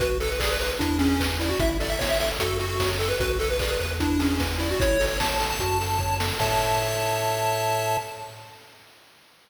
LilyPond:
<<
  \new Staff \with { instrumentName = "Lead 1 (square)" } { \time 4/4 \key a \major \tempo 4 = 150 b'16 r16 a'16 b'16 gis'16 b'16 b'16 r16 d'8 cis'8. r16 e'16 fis'16 | e''16 r16 d''16 e''16 cis''16 e''16 e''16 r16 a'8 fis'8. r16 a'16 b'16 | b'16 r16 a'16 b'16 gis'16 b'16 b'16 r16 d'8 cis'8. r16 e'16 fis'16 | cis''8. cis''16 a''8. a''4.~ a''16 r8 |
a''1 | }
  \new Staff \with { instrumentName = "Lead 1 (square)" } { \time 4/4 \key a \major fis'8 b'8 d''8 b'8 e'8 gis'8 b'8 d''8 | e'8 a'8 cis''8 a'8 fis'8 a'8 cis''8 a'8 | fis'8 b'8 d''8 b'8 e'8 gis'8 b'8 d''8 | e'8 a'8 cis''8 a'8 fis'8 a'8 cis''8 a'8 |
<a' cis'' e''>1 | }
  \new Staff \with { instrumentName = "Synth Bass 1" } { \clef bass \time 4/4 \key a \major b,,2 e,2 | a,,2 fis,2 | b,,4. e,2~ e,8 | a,,2 fis,2 |
a,1 | }
  \new DrumStaff \with { instrumentName = "Drums" } \drummode { \time 4/4 <hh bd>8 hho8 <hc bd>8 hho8 <hh bd>8 hho8 <hc bd>8 hho8 | <hh bd>8 hho8 <bd sn>8 hho8 <hh bd>8 hho8 <bd sn>8 hho8 | <hh bd>8 hho8 <hc bd>8 hho8 <hh bd>8 hho8 <bd sn>8 hho8 | <hh bd>8 hho8 <bd sn>8 hho8 <hh bd>8 hho8 bd8 sn8 |
<cymc bd>4 r4 r4 r4 | }
>>